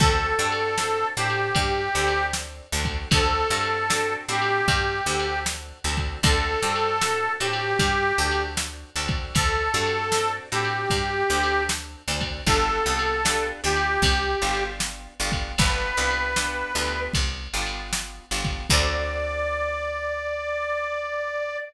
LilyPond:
<<
  \new Staff \with { instrumentName = "Harmonica" } { \time 4/4 \key d \major \tempo 4 = 77 a'4. g'4. r4 | a'4. g'4. r4 | a'4. g'4. r4 | a'4. g'4. r4 |
a'4. g'4. r4 | b'2 r2 | d''1 | }
  \new Staff \with { instrumentName = "Acoustic Guitar (steel)" } { \time 4/4 \key d \major <c' d' fis' a'>8 <c' d' fis' a'>8 <c' d' fis' a'>8 <c' d' fis' a'>4 <c' d' fis' a'>4 <c' d' fis' a'>8 | <c' d' fis' a'>8 <c' d' fis' a'>8 <c' d' fis' a'>8 <c' d' fis' a'>4 <c' d' fis' a'>4 <c' d' fis' a'>8 | <c' d' fis' a'>8 <c' d' fis' a'>8 <c' d' fis' a'>8 <c' d' fis' a'>4 <c' d' fis' a'>4 <c' d' fis' a'>8~ | <c' d' fis' a'>8 <c' d' fis' a'>8 <c' d' fis' a'>8 <c' d' fis' a'>4 <c' d' fis' a'>4 <c' d' fis' a'>8 |
<b d' f' g'>8 <b d' f' g'>8 <b d' f' g'>8 <b d' f' g'>4 <b d' f' g'>4 <b d' f' g'>8 | <b d' f' g'>8 <b d' f' g'>8 <b d' f' g'>8 <b d' f' g'>4 <b d' f' g'>4 <b d' f' g'>8 | <c' d' fis' a'>1 | }
  \new Staff \with { instrumentName = "Electric Bass (finger)" } { \clef bass \time 4/4 \key d \major d,8 g,4 a,8 g,8 d,4 d,8 | d,8 g,4 a,8 g,8 d,4 d,8 | d,8 g,4 a,8 g,8 d,4 d,8 | d,8 g,4 a,8 g,8 d,4 d,8 |
g,,8 c,4 d,8 c,8 g,,4 g,,8 | g,,8 c,4 d,8 c,8 g,,4 g,,8 | d,1 | }
  \new DrumStaff \with { instrumentName = "Drums" } \drummode { \time 4/4 \tuplet 3/2 { <cymc bd>8 r8 cymr8 sn8 r8 cymr8 <bd cymr>8 r8 cymr8 sn8 r8 <bd cymr>8 } | \tuplet 3/2 { <bd cymr>8 r8 cymr8 sn8 r8 cymr8 <bd cymr>8 r8 cymr8 sn8 r8 <bd cymr>8 } | \tuplet 3/2 { <bd cymr>8 r8 cymr8 sn8 r8 cymr8 <bd cymr>8 r8 cymr8 sn8 r8 <bd cymr>8 } | \tuplet 3/2 { <bd cymr>8 r8 cymr8 sn8 r8 cymr8 <bd cymr>8 r8 cymr8 sn8 r8 <bd cymr>8 } |
\tuplet 3/2 { <bd cymr>8 r8 cymr8 sn8 r8 cymr8 <bd cymr>8 r8 cymr8 sn8 r8 <bd cymr>8 } | \tuplet 3/2 { <bd cymr>8 r8 cymr8 sn8 r8 cymr8 <bd cymr>8 r8 cymr8 sn8 r8 <bd cymr>8 } | <cymc bd>4 r4 r4 r4 | }
>>